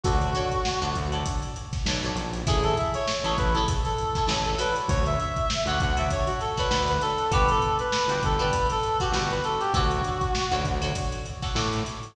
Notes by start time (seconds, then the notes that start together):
0.04 D2 F#4 A4 C#5 D5, kick, closed hi-hat
0.21 closed hi-hat
0.35 F#4 A4 C#5 D5, closed hi-hat
0.52 kick, closed hi-hat
0.65 snare
0.81 D2 F#4 A4 C#5 D5, snare, closed hi-hat
0.95 D2, kick, closed hi-hat
1.12 F#4 A4 C#5 D5, closed hi-hat
1.26 kick, closed hi-hat
1.43 closed hi-hat
1.56 closed hi-hat
1.73 kick, snare, closed hi-hat
1.86 B1 F#4 A4 C#5 D5, snare
2.03 F#4 A4 C#5 D5, closed hi-hat
2.15 A#1, closed hi-hat
2.33 closed hi-hat
2.47 A1 E4 G#4 A4 C#5, kick, closed hi-hat
2.63 A4, closed hi-hat
2.77 E5, closed hi-hat
2.94 C#5, closed hi-hat
3.07 C#5, snare
3.24 A1 E4 G#4 A4 C#5, snare, closed hi-hat
3.37 A1 B4, kick, closed hi-hat
3.53 E4 G#4 A4, closed hi-hat
3.58 C#5
3.68 kick, closed hi-hat
3.84 A4, closed hi-hat
3.98 closed hi-hat
4.15 E4 G#4 A4 C#5, kick, snare, closed hi-hat
4.27 A1 E4 G#4 A4 C#5, snare
4.45 A4, closed hi-hat
4.58 F#4 A4 B4 C#5 D5, closed hi-hat
4.76 closed hi-hat
4.88 D2 C#5, kick, closed hi-hat
5.06 E5, closed hi-hat
5.20 E5, closed hi-hat
5.36 kick, closed hi-hat
5.50 snare
5.66 D2 F#4 A4 C#5 F#5, closed hi-hat
5.70 D5
5.80 D2 F#5, kick, closed hi-hat
5.97 F#4 A4 C#5 D5 E5, closed hi-hat
6.10 C#5, kick, closed hi-hat
6.26 F#4, closed hi-hat
6.40 A4, snare, closed hi-hat
6.57 F#4 A4 B4 C#5 D5, kick, snare, closed hi-hat
6.70 D2 F#4 A4 C#5 D5, snare
6.88 B4, closed hi-hat
7.01 A4, snare, closed hi-hat
7.18 closed hi-hat
7.31 G1 F#4 G4 B4 D5, kick, closed hi-hat
7.48 A4, closed hi-hat
7.62 closed hi-hat
7.79 B4, closed hi-hat
7.92 snare
8.08 G1 F#4 G4 B4 D5, closed hi-hat
8.22 G1 A4, kick, closed hi-hat
8.39 F#4 G4 B4 D5, closed hi-hat
8.53 kick, closed hi-hat
8.70 A4, snare, closed hi-hat
8.83 closed hi-hat
9.00 F#4 G4 B4 D5, kick, snare, closed hi-hat
9.12 G1 F#4 G4 B4, snare
9.16 D5
9.30 B4, snare, closed hi-hat
9.44 A4, closed hi-hat
9.60 G4, closed hi-hat
9.74 D2 F#4 A4 C#5 D5, kick, closed hi-hat
9.91 closed hi-hat
10.04 closed hi-hat
10.21 kick, closed hi-hat
10.35 snare
10.51 D2 F#4 A4 C#5 D5, closed hi-hat
10.64 D2, kick, snare, closed hi-hat
10.82 F#4 A4 C#5 D5, closed hi-hat
10.95 kick, closed hi-hat
11.12 closed hi-hat
11.26 closed hi-hat
11.42 F#4 A4 C#5 D5, kick, snare, closed hi-hat
11.55 A2 F#4 A4 C#5 D5, snare
11.73 closed hi-hat
11.86 closed hi-hat
12.03 closed hi-hat